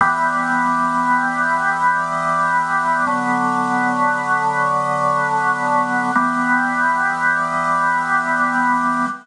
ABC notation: X:1
M:4/4
L:1/8
Q:1/4=78
K:Em
V:1 name="Drawbar Organ"
[E,G,B,]8 | [D,F,B,]8 | [E,G,B,]8 |]